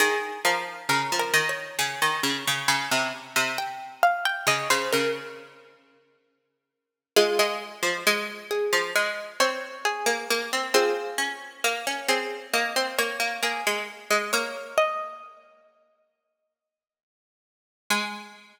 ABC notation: X:1
M:4/4
L:1/16
Q:1/4=67
K:Ab
V:1 name="Pizzicato Strings"
A2 B2 (3B2 B2 d2 a8 | g2 f g e c B8 z2 | [FA]6 A2 e2 d2 A4 | [FA]6 A2 e2 d2 A4 |
d2 e6 z8 | a16 |]
V:2 name="Pizzicato Strings"
E,2 F,2 D, F, E,2 D, E, D, D, D, C, z C, | z4 D, D, D,10 | A, A,2 F, A,3 F, A,2 C2 z B, B, C | C2 D2 B, D C2 B, C B, B, B, A, z A, |
B,10 z6 | A,16 |]